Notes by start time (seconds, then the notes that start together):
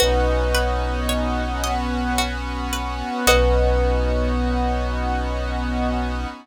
0.00 B1 B3 C#4 D#4 F#4 B4
0.55 B4
1.09 C#5
1.62 B3 C#4 F#4 B4 D#5
2.18 F#4
2.73 B4
3.27 B1 B3 C#4 D#4 F#4 B4 C#5 D#5